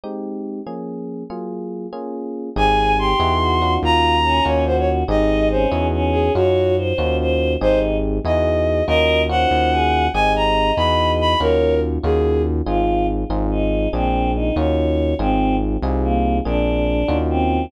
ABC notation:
X:1
M:6/8
L:1/16
Q:3/8=95
K:Abmix
V:1 name="Violin"
z12 | z12 | a4 c'8 | b6 d2 c d z2 |
e4 c2 z4 A2 | G4 z8 | c2 z4 e6 | e4 g8 |
a2 b4 _c'4 c'2 | B4 z2 A4 z2 | z12 | z12 |
z12 | z12 |]
V:2 name="Choir Aahs"
z12 | z12 | A4 =G4 _G4 | F4 D4 G4 |
E4 D4 D4 | d4 c4 c4 | E4 z8 | B4 c4 A4 |
e12 | d4 z8 | F4 z4 E4 | C4 E2 d6 |
C4 z4 B,4 | =D8 C4 |]
V:3 name="Electric Piano 1"
[A,CE=G]6 [F,B,DA]6 | [G,B,FA]6 [B,DFA]6 | [CE=GA]6 [E_F_GA]4 [DE=FG]2- | [DEFG]6 [DEFG]6 |
[CE=GA]6 [E_F_GA]6 | [DEFG]6 [DEFG]6 | [CE=GA]6 [E_F_GA]6 | [DEFG]4 [DEFG]8 |
[CE=GA]6 [E_F_GA]6 | [DEFG]6 [DEFG]6 | [CEFA]6 [CEFA]6 | [B,C=DA]6 [_DEFG]6 |
[CEFA]6 [CEFA]6 | [B,C=DA]6 [_DEFG]6 |]
V:4 name="Synth Bass 1" clef=bass
z12 | z12 | A,,,6 _F,,6 | E,,6 E,,6 |
A,,,6 _F,,6 | G,,6 E,,6 | A,,,6 _F,,6 | E,,6 E,,6 |
A,,,6 _F,,6 | E,,6 E,,6 | A,,,6 A,,,6 | B,,,6 E,,6 |
A,,,6 C,,6 | B,,,6 E,,6 |]